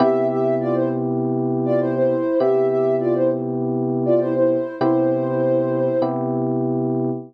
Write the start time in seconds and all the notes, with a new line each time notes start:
0.00 C3 B3 E4 G4 E5
0.30 G4 E5
0.60 F4 D5
0.74 E4 C5
1.65 F4 D5
1.80 E4 C5
1.95 E4 C5
2.40 C3 B3 E4 G4 E5
2.70 G4 E5
3.00 F4 D5
3.15 E4 C5
4.06 F4 D5
4.20 E4 C5
4.35 E4 C5
4.79 C3 B3 E4 G4 C5
6.02 C3 B3 E4 G4